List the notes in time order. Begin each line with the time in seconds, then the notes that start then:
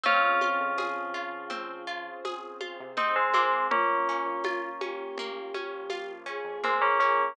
0.04 F2 C4 C#4 F4 G#4, low conga
0.23 C4
0.41 F4, high conga
0.60 F2
0.77 F2 F3 G#4, tambourine, high conga
1.14 F3 F4
1.50 C4, low conga
1.87 C4 F4 G#4 C5
2.25 G#4, tambourine, high conga
2.61 F4, high conga
2.80 C3
2.97 C4 D#4, low conga
3.16 G#3 C4
3.34 G#3 A#3 C4, high conga
3.71 A#1 A#3 C#4 F4, low conga
4.09 C#4
4.26 A#1
4.44 A#1 F4, tambourine, high conga
4.81 C#4 G4, high conga
5.18 A#3, low conga
5.54 F3 A#3 C#4 F4, high conga
5.90 F4, tambourine, high conga
6.26 C#4 G#4
6.44 F2
6.64 G#3 A#3 C4, low conga
6.82 A#3 C#4
7.00 A#3 C#4 G#4